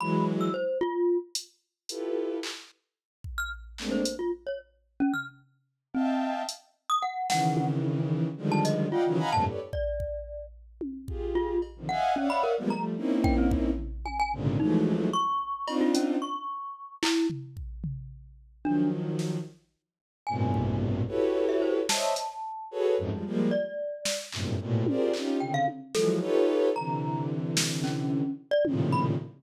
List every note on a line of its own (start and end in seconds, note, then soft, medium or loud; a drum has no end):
0.00 0.49 E3 medium
0.00 0.49 F#3 medium
0.00 0.49 G#3 medium
0.00 0.25 B5 medium
0.41 0.53 E6 medium
0.54 0.78 C5 medium
0.81 1.18 F4 loud
1.35 closed hi-hat loud
1.89 2.38 E4 medium
1.89 2.38 F4 medium
1.89 2.38 G4 medium
1.89 2.38 A4 medium
1.89 2.38 B4 medium
1.89 closed hi-hat medium
2.43 clap medium
3.24 kick medium
3.38 3.50 F6 medium
3.78 4.03 G#3 medium
3.78 4.03 A3 medium
3.78 4.03 A#3 medium
3.78 4.03 C4 medium
3.78 4.03 D4 medium
3.78 clap medium
3.91 4.16 C5 medium
4.05 closed hi-hat medium
4.19 4.31 F4 medium
4.47 4.59 C#5 medium
5.00 5.12 C#4 loud
5.14 5.26 F6 medium
5.14 floor tom soft
5.94 6.43 C4 medium
5.94 6.42 D#5 medium
5.94 6.42 E5 medium
5.94 6.42 F5 medium
5.94 6.42 G5 medium
5.94 6.42 A5 medium
6.49 closed hi-hat medium
6.90 7.02 D#6 loud
7.02 7.27 F#5 medium
7.30 8.27 C#3 medium
7.30 8.27 D#3 medium
7.30 8.27 E3 medium
7.30 7.66 F#5 loud
7.30 snare medium
7.57 high tom loud
7.84 high tom medium
8.37 8.86 D3 medium
8.37 8.86 D#3 medium
8.37 8.86 F3 medium
8.37 8.86 G3 medium
8.37 8.86 G#3 medium
8.52 8.64 A5 loud
8.65 8.89 D#5 medium
8.65 closed hi-hat medium
8.91 9.16 F4 medium
8.91 9.03 D5 medium
8.91 9.03 D#5 medium
8.91 9.03 F5 medium
8.91 9.03 F#5 medium
8.91 9.03 G5 medium
9.06 9.18 C#3 loud
9.06 9.18 D#3 loud
9.06 9.18 E3 loud
9.06 9.18 F#3 loud
9.18 9.30 D#5 medium
9.18 9.30 F5 medium
9.18 9.30 F#5 medium
9.18 9.30 G#5 medium
9.18 9.30 A#5 medium
9.18 9.30 B5 medium
9.32 9.44 F2 loud
9.32 9.44 G2 loud
9.32 9.44 A2 loud
9.32 9.44 A#2 loud
9.32 9.44 C3 loud
9.32 9.45 A5 loud
9.47 9.59 G4 medium
9.47 9.59 A4 medium
9.47 9.59 B4 medium
9.47 9.59 C#5 medium
9.47 9.59 D5 medium
9.73 10.46 D5 medium
9.73 kick medium
10.00 kick medium
10.81 high tom medium
11.08 11.57 F4 medium
11.08 11.57 G4 medium
11.08 11.57 G#4 medium
11.08 kick medium
11.35 11.60 F4 medium
11.62 cowbell medium
11.76 11.89 C3 medium
11.76 11.89 D3 medium
11.76 11.89 D#3 medium
11.76 11.89 F3 medium
11.89 12.14 D#5 medium
11.89 12.14 E5 medium
11.89 12.14 F5 medium
11.89 12.13 F#5 medium
11.89 12.14 F#5 medium
11.89 12.14 G#5 medium
12.16 12.28 C#4 medium
12.16 12.53 C#5 medium
12.16 12.53 D5 medium
12.16 12.53 E5 medium
12.16 12.53 F5 medium
12.16 12.53 F#5 medium
12.30 12.42 B5 loud
12.43 12.56 A#4 medium
12.58 12.70 F3 medium
12.58 12.70 G3 medium
12.58 12.70 G#3 medium
12.58 12.70 A#3 medium
12.58 12.70 B3 medium
12.70 12.96 F3 medium
12.70 12.96 G3 medium
12.70 12.96 A3 medium
12.70 12.83 A#5 medium
12.97 13.70 A#3 medium
12.97 13.70 C4 medium
12.97 13.70 C#4 medium
12.97 13.70 D#4 medium
12.97 13.70 E4 medium
13.24 13.36 G5 medium
13.24 kick loud
13.38 13.50 C4 loud
13.51 kick loud
13.78 floor tom medium
14.05 14.18 G#5 medium
14.05 high tom medium
14.19 14.32 G#5 loud
14.33 14.57 G#2 medium
14.33 14.57 A#2 medium
14.33 14.57 C3 medium
14.33 14.57 C#3 medium
14.33 14.57 D3 medium
14.60 15.08 E3 medium
14.60 15.08 F3 medium
14.60 15.08 F#3 medium
14.60 15.08 G#3 medium
14.60 15.08 A3 medium
14.60 15.08 D#4 medium
14.86 high tom medium
15.13 15.74 C#6 loud
15.67 16.16 C4 loud
15.67 16.16 D4 loud
15.67 16.16 D#4 loud
15.67 16.16 F4 loud
15.67 cowbell loud
15.81 15.93 F4 medium
15.95 16.19 C#4 medium
15.95 closed hi-hat loud
16.22 16.95 C#6 medium
17.03 17.27 E4 loud
17.03 clap loud
17.30 floor tom medium
17.57 kick medium
17.84 floor tom medium
18.64 19.37 D#3 medium
18.64 19.37 F3 medium
18.64 19.37 F#3 medium
18.64 18.89 D4 medium
19.19 snare medium
20.27 21.01 G2 medium
20.27 21.01 A2 medium
20.27 21.01 A#2 medium
20.27 21.01 B2 medium
20.27 21.01 C3 medium
20.27 20.75 G#5 medium
20.54 kick medium
21.07 21.80 E4 medium
21.07 21.80 F#4 medium
21.07 21.80 G4 medium
21.07 21.80 A4 medium
21.07 21.80 B4 medium
21.07 21.80 C#5 medium
21.49 21.61 E5 medium
21.62 21.74 C5 medium
21.89 22.14 C5 medium
21.89 22.14 C#5 medium
21.89 22.14 D#5 medium
21.89 22.14 E5 medium
21.89 23.36 A5 medium
21.89 snare loud
22.16 closed hi-hat medium
22.71 22.95 F#4 medium
22.71 22.95 G#4 medium
22.71 22.95 A4 medium
22.71 22.95 B4 medium
22.71 22.95 C#5 medium
22.98 23.10 F2 loud
22.98 23.10 F#2 loud
22.98 23.10 G#2 loud
23.11 23.24 F3 medium
23.11 23.24 G3 medium
23.11 23.24 G#3 medium
23.26 23.50 F3 medium
23.26 23.50 G3 medium
23.26 23.50 G#3 medium
23.26 23.50 A#3 medium
23.51 24.24 D5 medium
24.05 snare medium
24.32 24.56 F#2 medium
24.32 24.56 G2 medium
24.32 24.56 A2 medium
24.32 24.56 A#2 medium
24.32 24.56 C3 medium
24.32 clap medium
24.60 24.84 A2 medium
24.60 24.84 A#2 medium
24.60 24.84 B2 medium
24.86 25.12 F4 medium
24.86 25.12 G4 medium
24.86 25.12 G#4 medium
24.86 25.12 A#4 medium
24.86 25.12 C5 medium
24.86 25.12 D5 medium
24.86 high tom loud
25.14 25.39 C#4 medium
25.14 25.39 D#4 medium
25.14 25.39 F4 medium
25.14 25.39 G4 medium
25.14 clap medium
25.40 25.65 C3 medium
25.40 25.65 C#3 medium
25.40 25.65 D3 medium
25.40 25.52 G5 medium
25.54 25.66 F5 loud
25.68 high tom medium
25.94 26.19 E3 medium
25.94 26.19 F3 medium
25.94 26.19 F#3 medium
25.94 26.19 G#3 medium
25.94 26.19 A4 medium
25.94 snare medium
26.20 26.69 D#4 loud
26.20 26.69 F4 loud
26.20 26.69 G4 loud
26.20 26.69 A4 loud
26.20 26.69 B4 loud
26.20 26.69 C#5 loud
26.76 28.22 C3 medium
26.76 28.22 D3 medium
26.76 28.22 E3 medium
26.76 27.25 A#5 medium
27.57 snare loud
27.84 28.32 C#4 medium
27.84 clap medium
28.51 28.64 D5 loud
28.65 29.14 A2 medium
28.65 29.14 A#2 medium
28.65 29.14 C3 medium
28.65 29.14 C#3 medium
28.65 29.14 D#3 medium
28.65 29.14 F3 medium
28.65 high tom loud
28.92 29.05 B5 medium